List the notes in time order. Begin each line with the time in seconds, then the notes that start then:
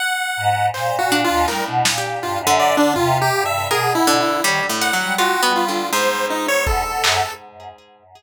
0.00 F#5
0.37 G#2
0.74 A#2 C5, clap
0.99 F#4
1.12 D4
1.24 F4
1.29 D#2
1.48 A2 G3 A#4, clap
1.67 B2
1.85 A#2, snare
1.98 G4
2.22 G2 F4
2.40 F#2
2.47 D3
2.59 D5
2.77 D3 D4
2.96 C3 F4, floor tom
3.21 G4
3.34 G2
3.46 E5
3.70 B2 G#4 A#4
3.95 E4
4.07 D3
4.20 E4
4.44 D#3 G3 C#5
4.69 A2
4.81 F#5, closed hi-hat
4.93 F#3
5.00 G3
5.18 F4 F#4
5.43 B3
5.56 F4
5.68 D3
5.93 G#2 C5
6.30 D#4
6.48 C#5
6.67 E2 A4, kick
6.85 B2
7.04 F#2 G#4, clap